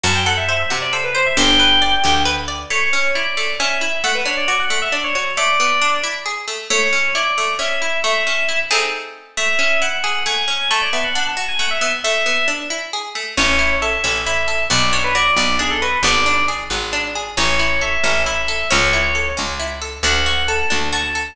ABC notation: X:1
M:6/8
L:1/16
Q:3/8=90
K:G
V:1 name="Electric Piano 2"
a g f e e e z d c B c e | g8 z4 | [K:A] c4 d4 e4 | f B c d d f2 e d c c z |
d6 z6 | c4 d4 e4 | e6 z6 | e4 f4 g4 |
a d e f f a2 g f e e z | e4 z8 | c4 e4 e4 | d2 c B d2 d2 G A B2 |
d4 z8 | c4 e4 e4 | c6 z6 | f4 a4 a4 |]
V:2 name="Harpsichord"
F2 A2 c2 F2 A2 c2 | G2 B2 d2 G2 B2 d2 | [K:A] A,2 C2 E2 A,2 C2 E2 | A,2 D2 F2 A,2 D2 F2 |
A,2 B,2 D2 E2 G2 A,2 | A,2 C2 E2 A,2 C2 E2 | A,2 C2 E2 [A,^B,^DG]6 | A,2 C2 E2 G2 A,2 C2 |
A,2 B,2 D2 F2 A,2 B,2 | A,2 B,2 D2 E2 G2 A,2 | C2 E2 A2 C2 E2 A2 | B,2 D2 F2 B,2 D2 F2 |
B,2 D2 G2 B,2 D2 G2 | C2 E2 A2 C2 E2 A2 | C2 E2 A2 C2 E2 A2 | D2 F2 A2 D2 F2 A2 |]
V:3 name="Electric Bass (finger)" clef=bass
F,,6 C,6 | G,,,6 D,,6 | [K:A] z12 | z12 |
z12 | z12 | z12 | z12 |
z12 | z12 | A,,,6 A,,,6 | B,,,6 B,,,6 |
G,,,6 G,,,6 | A,,,6 A,,,6 | C,,6 C,,6 | D,,6 D,,6 |]